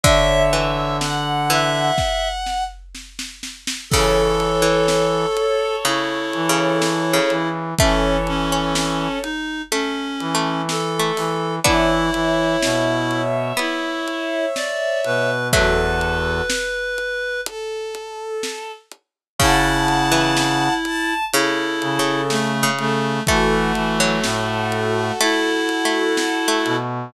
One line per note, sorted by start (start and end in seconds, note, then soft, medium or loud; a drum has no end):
0.04 0.50 D3 loud
0.04 1.91 D3 medium
0.04 0.97 C#5 loud
0.04 0.43 E5 loud
0.04 0.97 E5 loud
0.04 kick loud
0.04 closed hi-hat loud
0.53 1.40 E3 medium
1.01 2.64 F#5 loud
1.01 snare loud
1.50 3.20 E3 medium
1.50 2.28 E5 loud
1.98 kick loud
1.98 snare medium
2.46 snare medium
2.95 snare medium
3.19 snare loud
3.43 snare loud
3.67 snare loud
3.90 4.53 C#3 medium
3.90 5.26 E3 medium
3.90 5.76 A4 medium
3.90 7.32 A4 loud
3.90 7.32 C#5 loud
3.90 kick loud
3.90 crash loud
4.40 closed hi-hat medium
4.62 5.22 E3 medium
4.88 snare loud
5.37 closed hi-hat medium
5.85 6.38 C#3 medium
5.85 7.49 E4 medium
5.85 closed hi-hat loud
6.33 7.19 E3 medium
6.33 closed hi-hat medium
6.49 7.05 C#3 medium
6.82 snare loud
7.14 7.71 C#3 medium
7.30 7.74 E3 medium
7.30 closed hi-hat medium
7.78 9.08 E3 medium
7.78 8.42 A3 loud
7.78 8.17 C#4 medium
7.78 9.21 A4 medium
7.78 9.21 C#5 loud
7.78 kick loud
7.78 closed hi-hat loud
8.27 9.19 C#4 medium
8.27 closed hi-hat medium
8.52 9.19 C#4 medium
8.75 snare loud
9.23 9.62 D#4 medium
9.23 closed hi-hat loud
9.71 10.32 A3 medium
9.71 10.62 C#4 medium
9.71 closed hi-hat loud
10.20 11.11 E3 medium
10.20 closed hi-hat medium
10.35 10.94 A3 medium
10.69 11.55 A4 medium
10.69 snare loud
10.99 11.51 A3 medium
11.17 11.60 E3 medium
11.17 open hi-hat medium
11.65 12.10 E3 medium
11.65 13.29 B3 medium
11.65 13.29 D4 loud
11.65 13.22 E4 medium
11.65 15.30 C#5 medium
11.65 15.30 E5 medium
11.65 kick loud
11.65 closed hi-hat loud
12.13 12.56 E3 medium
12.13 closed hi-hat medium
12.63 13.53 B2 medium
12.63 snare loud
13.11 closed hi-hat medium
13.57 15.17 B3 medium
13.57 14.46 E4 medium
13.57 closed hi-hat loud
14.08 closed hi-hat medium
14.55 15.00 D5 medium
14.55 snare loud
15.04 15.52 B2 medium
15.04 15.48 B4 medium
15.04 closed hi-hat medium
15.53 16.41 E2 medium
15.53 18.26 F#3 medium
15.53 18.26 A3 medium
15.53 16.43 F#4 medium
15.53 16.43 A4 loud
15.53 17.41 B4 medium
15.53 kick loud
15.53 closed hi-hat loud
16.01 closed hi-hat medium
16.50 snare loud
16.98 closed hi-hat medium
17.46 18.72 A4 loud
17.46 closed hi-hat loud
17.95 closed hi-hat medium
18.43 snare loud
18.92 closed hi-hat medium
19.39 20.69 C#3 medium
19.39 20.01 C#3 medium
19.39 21.14 E4 loud
19.39 20.74 F#5 medium
19.39 20.74 A5 loud
19.39 kick loud
19.39 crash loud
19.88 closed hi-hat medium
20.12 20.78 E3 medium
20.37 snare loud
20.85 21.25 A5 loud
20.85 closed hi-hat medium
21.33 21.97 C#3 medium
21.33 22.21 E4 medium
21.33 22.50 A4 loud
21.33 closed hi-hat loud
21.81 22.64 C#3 medium
21.81 closed hi-hat medium
21.99 22.56 C#3 medium
22.30 22.71 A3 medium
22.30 snare loud
22.63 23.24 C#3 medium
22.79 23.20 C#3 medium
22.79 23.23 A3 medium
22.79 23.21 A4 loud
22.79 closed hi-hat medium
23.26 23.72 E3 medium
23.26 25.12 A3 medium
23.26 23.96 A3 medium
23.26 26.76 F#4 loud
23.26 26.76 A4 loud
23.26 kick loud
23.26 closed hi-hat loud
23.75 24.19 E3 medium
23.75 closed hi-hat medium
24.00 24.61 F#3 medium
24.23 25.11 A2 medium
24.23 snare loud
24.72 closed hi-hat medium
25.21 25.73 A3 medium
25.21 26.76 E4 loud
25.21 closed hi-hat loud
25.69 closed hi-hat medium
25.85 26.39 A3 medium
26.17 snare loud
26.48 27.08 A3 medium
26.65 27.11 B2 medium
26.65 closed hi-hat medium